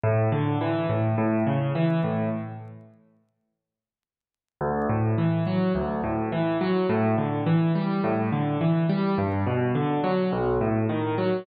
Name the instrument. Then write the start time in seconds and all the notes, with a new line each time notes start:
acoustic grand piano
0.04 A2
0.32 D3
0.61 E3
0.89 A2
1.18 A2
1.47 C#3
1.75 E3
2.04 A2
4.61 D2
4.89 A2
5.18 E3
5.47 F#3
5.75 D2
6.04 A2
6.32 E3
6.61 F#3
6.89 A2
7.18 D3
7.46 E3
7.75 G3
8.04 A2
8.32 D3
8.61 E3
8.90 G3
9.18 G2
9.47 B2
9.75 D3
10.04 F#3
10.32 B1
10.61 A2
10.89 D#3
11.18 F#3